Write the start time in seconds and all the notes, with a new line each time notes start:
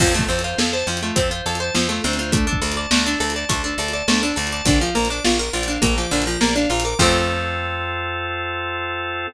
0.00 F2 F3 C4, kick, crash
0.14 A3 F4
0.19 kick
0.29 F2 C4 A4
0.39 closed hi-hat
0.44 F4 C5
0.58 F2 A4 F5, snare
0.73 C5 A5
0.87 F2 F3 C4
0.97 closed hi-hat
1.03 A3 F4
1.16 F2 C4 A4, kick, closed hi-hat
1.31 F4 C5
1.46 F2 A4 F5
1.55 closed hi-hat
1.60 C5 A5
1.75 F2 F3 C4, snare
1.89 A3 F4
2.04 D2 C4 A4
2.13 closed hi-hat
2.18 F4 C5
2.32 A3 D4, kick, closed hi-hat
2.47 D4 A4
2.53 kick
2.62 D2 A4 D5
2.72 closed hi-hat
2.76 D5 A5
2.91 D2 A3 D4, snare
3.05 D4 A4
3.20 D2 A4 D5
3.30 closed hi-hat
3.34 D5 A5
3.49 D2 A3 D4, kick, closed hi-hat
3.64 D4 A4
3.78 D2 A4 D5
3.88 closed hi-hat
3.93 D5 A5
4.08 D2 A3 D4, snare
4.22 D4 A4
4.36 D2 A4 D5
4.47 closed hi-hat
4.52 D5 A5
4.65 A#1 D3 D5, kick, closed hi-hat
4.81 F3 F5
4.95 A#1 A#3 A#5
5.05 closed hi-hat
5.10 D4 D6
5.25 A#1 F4 F6, snare
5.39 A#4 A#6
5.53 A#1 F4 D5
5.63 closed hi-hat
5.68 D4 F5
5.82 A#1 A#3 A#5, kick, closed hi-hat
5.98 F3 D6
6.11 A#1 D3 F6
6.22 closed hi-hat
6.26 F3 A#6
6.41 A#1 A#3 D5, snare
6.56 D4 F5
6.70 A#1 F4 A#5
6.80 closed hi-hat
6.84 A#4 D6
6.99 F2 F3 A3 C4 F4 A4, kick, crash